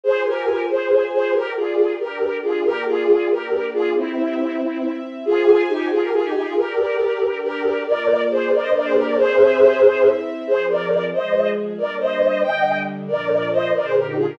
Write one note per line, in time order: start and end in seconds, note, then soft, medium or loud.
0.03 0.68 F4 medium
0.03 0.22 G#4 medium
0.03 0.22 C5 loud
0.03 0.68 C5 medium
0.03 0.68 G#5 medium
0.26 0.61 G4 medium
0.26 0.61 A#4 medium
0.69 1.35 F4 medium
0.69 1.04 G#4 medium
0.69 1.35 G#4 medium
0.69 1.04 C5 medium
0.69 1.35 G#5 soft
1.13 1.33 G#4 medium
1.13 1.33 C5 medium
1.34 1.99 G4 medium
1.34 1.53 G4 medium
1.34 1.99 A#4 medium
1.34 1.53 A#4 loud
1.34 1.99 D5 medium
1.56 1.92 F4 medium
1.56 1.92 G#4 medium
1.99 2.64 D4 medium
1.99 2.64 G4 medium
1.99 2.37 G4 medium
1.99 2.37 A#4 medium
1.99 2.64 D5 medium
2.43 2.63 F4 medium
2.43 2.63 G#4 medium
2.64 3.29 A#3 medium
2.64 3.29 F4 medium
2.64 2.84 G4 loud
2.64 2.84 A#4 loud
2.64 3.29 D5 medium
2.87 3.28 F4 medium
2.87 3.28 G#4 loud
3.30 3.95 A#3 medium
3.30 3.95 D4 medium
3.30 3.66 G4 medium
3.30 3.66 A#4 medium
3.30 3.95 D5 medium
3.73 3.93 F4 medium
3.73 3.93 G#4 loud
3.95 4.59 C4 medium
3.95 4.91 C4 medium
3.95 4.91 E4 medium
3.95 4.60 G4 medium
3.95 4.59 E5 medium
4.60 5.24 C4 medium
4.60 5.24 E4 medium
4.60 5.24 E5 medium
5.25 5.62 F4 loud
5.25 5.90 F4 medium
5.25 5.62 G#4 loud
5.25 5.90 C5 medium
5.25 5.90 G#5 medium
5.69 5.88 D#4 medium
5.69 5.88 G4 loud
5.90 6.01 F4 loud
5.90 6.56 F4 medium
5.90 6.01 G#4 loud
5.90 6.56 G#4 medium
5.90 6.56 G#5 medium
6.02 6.12 G4 medium
6.02 6.12 A#4 loud
6.12 6.22 F4 medium
6.12 6.22 G#4 loud
6.24 6.33 D#4 medium
6.24 6.33 G4 loud
6.34 6.44 D#4 medium
6.34 6.44 G4 loud
6.45 6.56 F4 medium
6.45 6.56 G#4 medium
6.56 7.38 G4 medium
6.56 7.20 G4 medium
6.56 7.38 A#4 medium
6.56 7.21 A#4 medium
6.56 7.20 D5 medium
7.20 7.85 D4 medium
7.20 7.85 G4 medium
7.20 7.85 D5 medium
7.43 7.82 G4 medium
7.43 7.82 A#4 loud
7.85 8.50 A#3 medium
7.85 8.50 F4 medium
7.85 8.21 A#4 medium
7.85 8.50 D5 medium
7.85 8.21 D5 loud
8.31 8.51 G#4 medium
8.31 8.51 C5 medium
8.52 9.17 A#3 medium
8.52 9.17 D4 medium
8.52 8.62 A#4 medium
8.52 8.62 D5 medium
8.52 9.17 D5 medium
8.62 8.72 C5 medium
8.62 8.72 D#5 loud
8.74 8.84 A#4 medium
8.74 8.84 D5 medium
8.84 8.95 G#4 medium
8.84 8.95 C5 loud
8.95 9.05 G4 medium
8.95 9.05 A#4 loud
9.06 9.16 A#4 medium
9.06 9.16 D5 loud
9.16 9.81 C4 medium
9.16 9.81 G4 medium
9.16 10.08 G#4 loud
9.16 10.08 C5 loud
9.16 9.81 E5 medium
9.82 10.47 C4 medium
9.82 10.47 E4 medium
9.82 10.47 E5 medium
10.47 11.12 F3 medium
10.47 11.12 C4 medium
10.47 10.66 G#4 medium
10.47 11.12 G#4 medium
10.47 10.66 C5 loud
10.69 11.04 A#4 medium
10.69 11.04 D5 medium
11.13 11.78 F3 medium
11.13 11.78 G#3 medium
11.13 11.78 G#4 medium
11.13 11.49 C5 medium
11.13 11.49 D#5 medium
11.78 12.42 G3 medium
11.78 12.42 A#3 medium
11.78 12.42 D4 medium
11.78 11.96 A#4 medium
11.78 11.96 D5 medium
12.00 12.41 C5 medium
12.00 12.41 D#5 medium
12.42 13.08 D3 medium
12.42 13.08 G3 medium
12.42 13.07 D4 medium
12.42 12.78 D#5 medium
12.42 12.78 G5 medium
13.07 13.72 A#2 medium
13.07 13.72 F3 medium
13.07 13.72 D4 medium
13.07 13.48 A#4 medium
13.07 13.48 D5 medium
13.52 13.71 C5 medium
13.52 13.71 D#5 loud
13.74 14.38 A#2 medium
13.74 14.38 D3 medium
13.74 14.38 D4 medium
13.74 13.84 A#4 medium
13.74 13.84 D5 medium
13.84 13.95 G#4 medium
13.84 13.95 C5 loud
13.95 14.06 G4 medium
13.95 14.06 A#4 medium
14.07 14.17 D#4 medium
14.07 14.17 G4 medium
14.16 14.26 F4 medium
14.16 14.26 G#4 medium
14.28 14.38 G4 medium
14.28 14.38 A#4 medium